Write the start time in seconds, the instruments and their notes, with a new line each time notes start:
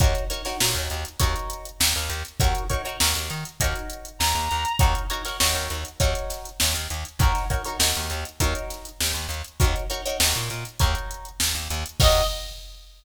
0.00 electric bass (finger) D#2, acoustic guitar (steel) D#4 F#4 A#4 C#5, kick, closed hi-hat
0.15 closed hi-hat
0.30 acoustic guitar (steel) D#4 F#4 A#4 C#5, closed hi-hat
0.45 acoustic guitar (steel) D#4 F#4 A#4 C#5, snare, closed hi-hat
0.60 electric bass (finger) A#2, acoustic guitar (steel) D#4 F#4 A#4 C#5, snare
0.75 electric bass (finger) D#2, closed hi-hat
0.90 electric bass (finger) D#2, closed hi-hat
1.05 closed hi-hat
1.20 electric bass (finger) D#2, acoustic guitar (steel) D#4 F#4 A#4 C#5, kick, closed hi-hat
1.36 closed hi-hat
1.50 closed hi-hat
1.65 closed hi-hat
1.80 electric bass (finger) D#2, snare
1.95 electric bass (finger) D#2, snare, closed hi-hat
2.10 electric bass (finger) D#2, closed hi-hat
2.25 closed hi-hat
2.40 electric bass (finger) D#2, acoustic guitar (steel) D#4 F#4 A#4 C#5, kick, closed hi-hat
2.55 closed hi-hat
2.69 acoustic guitar (steel) D#4 F#4 A#4 C#5, kick, closed hi-hat
2.85 acoustic guitar (steel) D#4 F#4 A#4 C#5, closed hi-hat
3.00 electric bass (finger) D#2, acoustic guitar (steel) D#4 F#4 A#4 C#5, snare
3.15 electric bass (finger) D#2, closed hi-hat
3.30 electric bass (finger) D#3, closed hi-hat
3.45 closed hi-hat
3.60 electric bass (finger) D#2, acoustic guitar (steel) D#4 F#4 A#4 C#5, kick, closed hi-hat
3.75 closed hi-hat
3.90 closed hi-hat
4.05 closed hi-hat
4.19 electric bass (finger) D#2, clarinet A#5, snare
4.35 electric bass (finger) D#2, snare, closed hi-hat
4.51 electric bass (finger) D#2, closed hi-hat
4.65 closed hi-hat
4.79 electric bass (finger) D#2, acoustic guitar (steel) D#4 F#4 A#4 C#5, kick, closed hi-hat
4.95 closed hi-hat
5.10 acoustic guitar (steel) D#4 F#4 A#4 C#5, closed hi-hat
5.25 acoustic guitar (steel) D#4 F#4 A#4 C#5, snare, closed hi-hat
5.40 electric bass (finger) D#2, acoustic guitar (steel) D#4 F#4 A#4 C#5, snare
5.55 electric bass (finger) D#2, closed hi-hat
5.70 electric bass (finger) D#2, closed hi-hat
5.85 closed hi-hat
6.00 electric bass (finger) D#2, acoustic guitar (steel) D#4 F#4 A#4 C#5, kick, closed hi-hat
6.15 closed hi-hat
6.30 snare, closed hi-hat
6.45 closed hi-hat
6.60 electric bass (finger) D#2, snare
6.74 electric bass (finger) D#2, closed hi-hat
6.90 electric bass (finger) D#2, closed hi-hat
7.05 closed hi-hat
7.19 electric bass (finger) D#2, acoustic guitar (steel) D#4 F#4 A#4 C#5, kick, closed hi-hat
7.35 snare, closed hi-hat
7.50 acoustic guitar (steel) D#4 F#4 A#4 C#5, kick, closed hi-hat
7.65 acoustic guitar (steel) D#4 F#4 A#4 C#5, closed hi-hat
7.79 electric bass (finger) D#2, acoustic guitar (steel) D#4 F#4 A#4 C#5, snare
7.95 electric bass (finger) D#2, closed hi-hat
8.10 electric bass (finger) D#2, closed hi-hat
8.25 closed hi-hat
8.40 electric bass (finger) D#2, acoustic guitar (steel) D#4 F#4 A#4 C#5, kick, closed hi-hat
8.55 closed hi-hat
8.70 snare, closed hi-hat
8.85 closed hi-hat
9.01 electric bass (finger) D#2, snare
9.14 electric bass (finger) D#2, snare, closed hi-hat
9.29 electric bass (finger) D#2, closed hi-hat
9.45 closed hi-hat
9.60 electric bass (finger) D#2, acoustic guitar (steel) D#4 F#4 A#4 C#5, kick, closed hi-hat
9.76 closed hi-hat
9.90 acoustic guitar (steel) D#4 F#4 A#4 C#5, closed hi-hat
10.05 acoustic guitar (steel) D#4 F#4 A#4 C#5, closed hi-hat
10.20 electric bass (finger) D#2, acoustic guitar (steel) D#4 F#4 A#4 C#5, snare
10.35 electric bass (finger) A#2, closed hi-hat
10.50 electric bass (finger) A#2, closed hi-hat
10.65 closed hi-hat
10.79 electric bass (finger) D#2, acoustic guitar (steel) D#4 F#4 A#4 C#5, kick, closed hi-hat
10.95 closed hi-hat
11.11 closed hi-hat
11.25 closed hi-hat
11.40 electric bass (finger) D#2, snare
11.55 electric bass (finger) D#2, closed hi-hat
11.70 electric bass (finger) D#2, closed hi-hat
11.86 closed hi-hat
12.00 electric bass (finger) D#2, acoustic guitar (steel) D#4 F#4 A#4 C#5, clarinet D#5, kick, crash